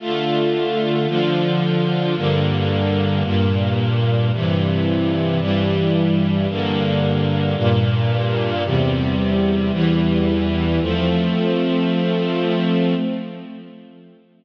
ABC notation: X:1
M:4/4
L:1/8
Q:1/4=111
K:F
V:1 name="String Ensemble 1"
[D,A,F]4 [D,F,F]4 | [G,,D,B,]4 [G,,B,,B,]4 | [G,,C,E,]4 [G,,E,G,]4 | [G,,D,B,]4 [G,,B,,B,]4 |
[E,,C,G,]4 [E,,E,G,]4 | [F,A,C]8 |]